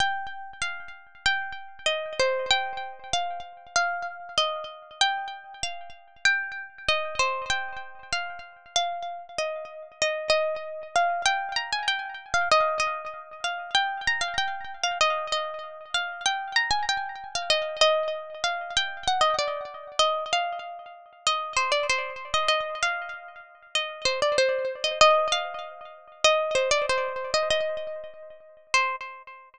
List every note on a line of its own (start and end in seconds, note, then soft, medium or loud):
0.00 0.51 G5 medium
0.61 0.91 F5 medium
1.26 1.87 G5 medium
1.86 2.13 D#5 medium
2.19 2.49 C5 medium
2.50 3.09 G5 medium
3.13 3.42 F5 medium
3.76 4.29 F5 medium
4.38 4.65 D#5 medium
5.01 5.55 G5 medium
5.63 5.92 F5 medium
6.25 6.83 G5 medium
6.88 7.15 D#5 medium
7.19 7.45 C5 medium
7.50 8.01 G5 medium
8.12 8.40 F5 medium
8.76 9.27 F5 medium
9.38 9.88 D#5 medium
10.02 10.29 D#5 medium
10.29 10.87 D#5 medium
10.96 11.24 F5 medium
11.25 11.53 G5 loud
11.56 11.71 A#5 medium
11.72 11.87 G#5 medium
11.88 12.30 G5 medium
12.34 12.48 F5 medium
12.51 12.78 D#5 medium
12.80 13.38 D#5 medium
13.44 13.70 F5 medium
13.74 14.04 G5 medium
14.07 14.22 A#5 medium
14.21 14.36 F5 medium
14.38 14.77 G5 medium
14.83 14.98 F5 medium
15.01 15.27 D#5 medium
15.32 15.84 D#5 medium
15.94 16.22 F5 medium
16.26 16.56 G5 medium
16.56 16.71 A#5 medium
16.70 16.85 G#5 medium
16.89 17.28 G5 medium
17.35 17.50 F5 medium
17.50 17.76 D#5 medium
17.81 18.33 D#5 medium
18.44 18.73 F5 medium
18.76 19.04 G5 medium
19.07 19.22 F#5 medium
19.21 19.36 D#5 medium
19.39 19.95 D5 medium
19.99 20.24 D#5 medium
20.33 20.92 F5 medium
21.27 21.55 D#5 medium
21.56 21.71 C5 medium
21.72 21.86 D5 medium
21.89 22.31 C5 medium
22.34 22.48 D#5 medium
22.48 22.79 D#5 medium
22.82 23.43 F5 medium
23.75 24.05 D#5 medium
24.05 24.20 C5 medium
24.22 24.37 D5 medium
24.38 24.77 C5 medium
24.84 24.99 D#5 medium
25.01 25.27 D#5 medium
25.32 25.88 F5 medium
26.24 26.54 D#5 loud
26.55 26.70 C5 medium
26.71 26.86 D5 medium
26.89 27.30 C5 medium
27.34 27.49 D#5 medium
27.50 28.38 D#5 medium
28.74 28.96 C5 loud